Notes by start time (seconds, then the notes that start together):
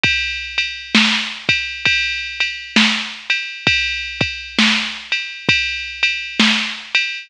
0.03 kick, ride
0.58 ride
0.95 snare
1.49 kick, ride
1.85 kick, ride
2.40 ride
2.76 snare
3.30 ride
3.67 kick, ride
4.21 kick, ride
4.59 snare
5.12 ride
5.49 kick, ride
6.03 ride
6.40 snare
6.95 ride